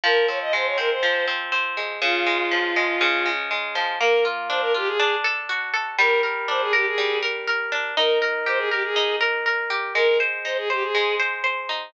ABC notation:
X:1
M:4/4
L:1/16
Q:1/4=121
K:Ebmix
V:1 name="Violin"
B2 d e c d B c3 z6 | F12 z4 | [K:Bbmix] B2 z2 c B G A3 z6 | B2 z2 c A G A3 z6 |
B2 z2 c A G A3 z6 | B2 z2 c A G A3 z6 |]
V:2 name="Orchestral Harp"
F,2 C2 A,2 C2 F,2 C2 C2 A,2 | D,2 A,2 F,2 A,2 D,2 A,2 A,2 F,2 | [K:Bbmix] B,2 F2 D2 F2 D2 =A2 ^F2 A2 | G,2 B2 D2 B2 G,2 B2 B2 D2 |
E2 B2 G2 B2 E2 B2 B2 G2 | A,2 c2 E2 c2 A,2 c2 c2 E2 |]